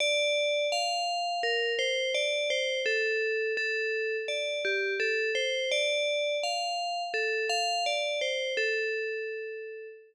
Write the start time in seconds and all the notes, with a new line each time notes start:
0.00 D5
0.72 F5
1.43 A#4
1.79 C5
2.14 D5
2.50 C5
2.86 A4
3.57 A4
4.28 D5
4.65 G4
5.00 A4
5.35 C5
5.71 D5
6.43 F5
7.14 A4
7.49 F5
7.86 D5
8.21 C5
8.57 A4